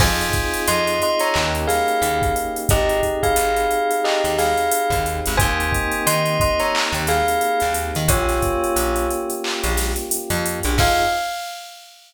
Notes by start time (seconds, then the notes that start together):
0.00 F2 C4 D#4 F4 G#4 C5 G#5, kick, crash
0.21 closed hi-hat
0.33 kick, closed hi-hat
0.54 closed hi-hat
0.68 F2 D#5 C6, closed hi-hat
0.87 closed hi-hat
1.02 D#5 C6, closed hi-hat
1.20 C#5 A#5, closed hi-hat
1.34 D#2 A#3 C#4 D#4 G4, clap
1.55 closed hi-hat
1.67 G#4 F5, snare, closed hi-hat
1.88 closed hi-hat
2.02 D#2, closed hi-hat
2.22 kick, closed hi-hat
2.36 closed hi-hat
2.56 closed hi-hat
2.69 G#1 C4 D#4 G4 G#4 D#5, kick, closed hi-hat
2.89 closed hi-hat
3.03 kick, closed hi-hat
3.23 G#4 F5, kick, closed hi-hat
3.36 G#1, closed hi-hat
3.56 closed hi-hat
3.71 closed hi-hat
3.91 closed hi-hat
4.04 G4 D#5, clap
4.24 D#2, closed hi-hat
4.38 G#4 F5, snare, closed hi-hat
4.57 closed hi-hat
4.71 closed hi-hat
4.90 D#2, kick, closed hi-hat
5.06 closed hi-hat
5.26 G#1, closed hi-hat
5.37 D#2 A#3 C4 D#4 G4 C5 G#5, kick, closed hi-hat
5.60 closed hi-hat
5.72 kick, closed hi-hat
5.92 closed hi-hat
6.07 D#3 D#5 C6, closed hi-hat
6.26 closed hi-hat
6.40 D#5 C6, kick, closed hi-hat
6.59 C#5 A#5, closed hi-hat
6.75 clap
6.92 D#2, closed hi-hat
7.07 G#4 F5, snare, closed hi-hat
7.28 closed hi-hat
7.41 closed hi-hat
7.60 D#2, snare, closed hi-hat
7.74 closed hi-hat
7.95 D#3, closed hi-hat
8.08 A#1 A#3 C#4 F4 G4 C#5, kick, closed hi-hat
8.29 snare, closed hi-hat
8.42 kick, closed hi-hat
8.64 closed hi-hat
8.76 A#1, closed hi-hat
8.96 closed hi-hat
9.11 closed hi-hat
9.30 closed hi-hat
9.44 clap
9.63 A#1, closed hi-hat
9.77 snare, closed hi-hat
9.96 closed hi-hat
10.11 closed hi-hat
10.30 F2, closed hi-hat
10.46 closed hi-hat
10.63 A#1, closed hi-hat
10.78 F2 C4 D#4 F4 G#4 F5, kick, crash